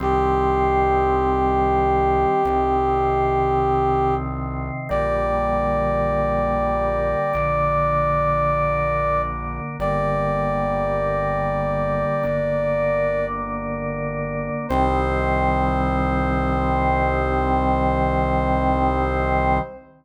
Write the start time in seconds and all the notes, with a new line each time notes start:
0.00 C2 D#3 G3 C4 G4
2.45 C2 C3 D#3 C4
4.89 A#1 D3 G3 A#3 D5
7.33 A#1 D3 A#3 D4
9.79 G1 D3 G3 A#3 D5
12.23 G1 D3 A#3 D4
14.69 C2 D#3 G3 C4 C5